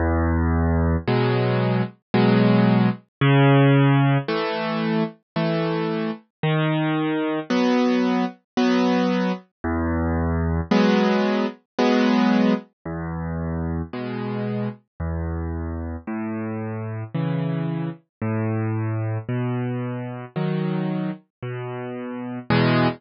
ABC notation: X:1
M:3/4
L:1/8
Q:1/4=56
K:E
V:1 name="Acoustic Grand Piano"
E,,2 [B,,F,G,]2 [B,,F,G,]2 | C,2 [E,A,]2 [E,A,]2 | D,2 [F,B,]2 [F,B,]2 | E,,2 [F,G,B,]2 [F,G,B,]2 |
E,,2 [B,,G,]2 E,,2 | A,,2 [C,E,]2 A,,2 | B,,2 [D,F,]2 B,,2 | [E,,B,,G,]2 z4 |]